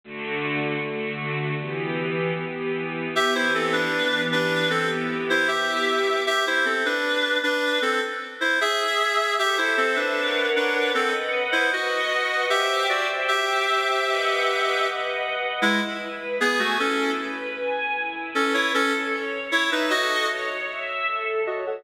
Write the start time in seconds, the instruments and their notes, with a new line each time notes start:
0.04 string ensemble 1 D3 A3 F#4
0.81 string ensemble 1 D3 A3 F#4
1.60 string ensemble 1 E3 B3 G4
2.38 string ensemble 1 E3 B3 G4
3.16 string ensemble 1 E3 B3 G4, clarinet G4 E5
3.35 clarinet E4 C5
3.55 clarinet C4 A4
3.73 clarinet D4 B4
3.93 string ensemble 1 E3 B3 G4
4.32 clarinet D4 B4
4.70 string ensemble 1 B3 E4 G4, clarinet C4 A4
5.30 clarinet E4 C5
5.48 string ensemble 1 B3 E4 G4, clarinet G4 E5
6.27 clarinet G4 E5
6.47 clarinet E4 C5
6.65 clarinet C4 A4
6.85 clarinet D4 B4
7.43 clarinet D4 B4
7.82 clarinet C4 A4
8.41 clarinet E4 C5
8.61 clarinet G#4 E5
9.39 clarinet G4 E5, string ensemble 1 A4 C5 E5
9.58 clarinet E4 C5
9.77 clarinet C4 A4
9.96 clarinet D4 B4
10.16 string ensemble 1 A#4 C#5 F#5
10.56 clarinet D4 B4
10.95 clarinet C4 A4, string ensemble 1 B4 D#5 F#5
11.52 clarinet E4 C5
11.72 clarinet F#4 D#5, string ensemble 1 B4 D#5 F#5
12.50 clarinet G4 E5, string ensemble 1 C5 E5 G5
12.89 clarinet F#4 D5
13.28 clarinet G4 E5, string ensemble 1 C5 E5 G5
14.07 string ensemble 1 B4 D#5 F#5
14.85 string ensemble 1 B4 D#5 F#5
15.62 clarinet G#3 E4, string ensemble 1 E4
16.00 string ensemble 1 B4
16.40 clarinet B3 G#4, string ensemble 1 G#5
16.59 clarinet A3 F#4
16.79 clarinet C#4 A4, string ensemble 1 E4
17.19 string ensemble 1 B4
17.56 string ensemble 1 G#5
17.95 string ensemble 1 E4
18.35 clarinet C#4 A4, string ensemble 1 B4
18.54 clarinet E4 C#5
18.73 clarinet C#4 A4, string ensemble 1 A4
19.13 string ensemble 1 C#5
19.51 clarinet E4 C#5, string ensemble 1 E5
19.72 clarinet D#4 B4
19.89 clarinet F#4 D#5, string ensemble 1 A4
20.28 string ensemble 1 C#5
20.69 string ensemble 1 E5
21.07 string ensemble 1 A4
21.46 clarinet F#4 D#5, string ensemble 1 C#5
21.67 clarinet A4 F#5